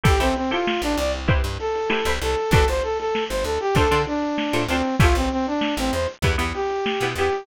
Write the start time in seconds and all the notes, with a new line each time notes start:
0.03 A1 E4 G4 A4 C5, kick, closed hi-hat
0.20 A1 C4 E4 G4 A4 C5, closed hi-hat
0.35 C4, snare, closed hi-hat
0.51 E4 F4 G4 A4 C5
0.67 snare
0.82 A1 D4, snare, closed hi-hat
0.97 C2 D5, closed hi-hat
1.14 closed hi-hat
1.28 E4 G4 B4 C5, kick, closed hi-hat
1.44 G2, closed hi-hat
1.59 A4, snare, closed hi-hat
1.75 closed hi-hat
1.90 E4 G4 B4 C5, snare
2.05 C2 E4 G4 B4 C5, closed hi-hat
2.21 C2 A4, closed hi-hat
2.37 closed hi-hat
2.51 G1 D4 F#4 G4 A4 B4, kick, closed hi-hat
2.68 G1 C5, closed hi-hat
2.83 A4, closed hi-hat
2.99 A4, snare, closed hi-hat
3.15 snare
3.29 G1 C5, snare, closed hi-hat
3.44 D2 A4, closed hi-hat
3.60 G4, closed hi-hat
3.75 D2 D4 F4 A4 C5, kick, closed hi-hat
3.91 D3 D4 F4 A4 C5, closed hi-hat
4.07 D4, closed hi-hat
4.22 closed hi-hat
4.38 snare
4.53 A2 D4 F4 A4 C5, closed hi-hat
4.68 D2 C4 D4 F4 A4 C5, snare, closed hi-hat
4.85 closed hi-hat
5.00 A1 C#4 E4 F4 G4 A4, kick, closed hi-hat
5.15 A1 C4, closed hi-hat
5.30 C4, closed hi-hat
5.47 D4, closed hi-hat
5.61 snare
5.77 A1 C4, closed hi-hat
5.92 E2 C5, closed hi-hat
6.07 closed hi-hat
6.22 E2 B3 E4 G4, kick, closed hi-hat
6.38 E2 B3 E4 G4, closed hi-hat
6.54 G4, closed hi-hat
6.70 closed hi-hat
6.86 snare
7.01 B2 B3 E4 G4, closed hi-hat
7.16 E2 B3 E4 G4, closed hi-hat
7.33 closed hi-hat